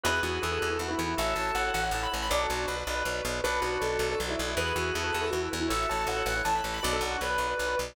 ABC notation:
X:1
M:6/8
L:1/16
Q:3/8=106
K:Bdor
V:1 name="Acoustic Grand Piano"
B2 F2 A2 A A F E z E | e2 a2 f2 f f a b z b | d A F F B6 z2 | B2 F2 A2 A A F E z E |
B2 F2 A2 A A F E z E | e2 a2 f2 f f a b z b | d A F F B6 z2 |]
V:2 name="Drawbar Organ"
[GB]8 z4 | [FA]8 z4 | [DF]4 z8 | [DF]8 z4 |
[GB]8 z4 | [FA]8 z4 | [DF]4 z8 |]
V:3 name="Drawbar Organ"
[EFB]2 [EFB]2 [EFB] [EFB] [EFB] [EFB] [EFB] [EFB] [EFB]2 | [EAc]2 [EAc]2 [EAc] [EAc] [EAc] [EAc] [EAc] [EAc] [EAc]2 | [FBd]2 [FBd]2 [FBd] [FBd] [FBd] [FBd] [FBd] [FBd] [FBd]2 | [FBd]2 [FBd]2 [FBd] [FBd] [FBd] [FBd] [FBd] [FBd] [FBd]2 |
[EFB]2 [EFB]2 [EFB] [EFB] [EFB] [EFB] [EFB] [EFB] [EFB]2 | [EAc]2 [EAc]2 [EAc] [EAc] [EAc] [EAc] [EAc] [EAc] [EAc]2 | [FBd]2 [FBd]2 [FBd] [FBd] [FBd] [FBd] [FBd] [FBd] [FBd]2 |]
V:4 name="Electric Bass (finger)" clef=bass
E,,2 E,,2 E,,2 E,,2 E,,2 E,,2 | A,,,2 A,,,2 A,,,2 A,,,2 A,,,2 A,,,2 | B,,,2 B,,,2 B,,,2 B,,,2 B,,,2 B,,,2 | B,,,2 B,,,2 B,,,2 B,,,2 B,,,2 B,,,2 |
E,,2 E,,2 E,,2 E,,2 E,,2 E,,2 | A,,,2 A,,,2 A,,,2 A,,,2 A,,,2 A,,,2 | B,,,2 B,,,2 B,,,2 B,,,2 B,,,2 B,,,2 |]